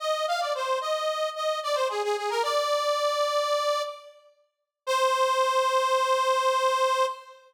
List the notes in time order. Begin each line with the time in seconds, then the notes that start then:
0.00 D#5
0.28 F5
0.40 D5
0.55 C5
0.81 D#5
1.36 D#5
1.63 D5
1.75 C5
1.89 G#4
2.04 G#4
2.17 G#4
2.30 A#4
2.43 D5
4.87 C5